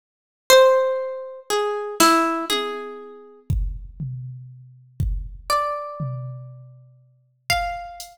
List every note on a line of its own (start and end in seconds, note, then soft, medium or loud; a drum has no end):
0.50 1.40 C5 loud
1.50 1.95 G#4 medium
2.00 2.45 E4 medium
2.00 snare medium
2.50 3.40 G#4 medium
2.50 high tom medium
3.50 kick medium
4.00 floor tom medium
5.00 kick medium
5.50 7.30 D5 medium
6.00 floor tom medium
7.50 8.18 F5 medium
7.50 kick medium
8.00 closed hi-hat medium